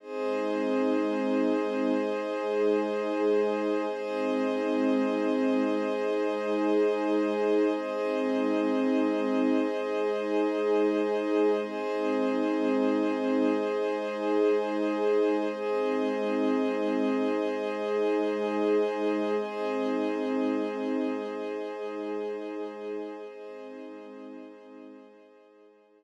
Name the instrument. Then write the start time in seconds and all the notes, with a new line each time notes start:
pad 2 (warm)
0.00 G#3 C4 D#4 G#4 C5 D#5
1.94 G#3 D#4 G#4
3.87 G#3 C4 D#4 G#4 C5 D#5
5.80 G#3 D#4 G#4
7.74 G#3 C4 D#4 G#4 C5 D#5
9.69 G#3 D#4 G#4
11.61 G#3 C4 D#4 G#4 C5 D#5
13.55 G#3 D#4 G#4
15.48 G#3 C4 D#4 G#4 C5 D#5
17.43 G#3 D#4 G#4
19.35 G#3 C4 D#4 G#4 C5 D#5
21.28 G#3 D#4 G#4
23.23 G#3 C4 D#4 G#4 C5 D#5
25.16 G#3 D#4 G#4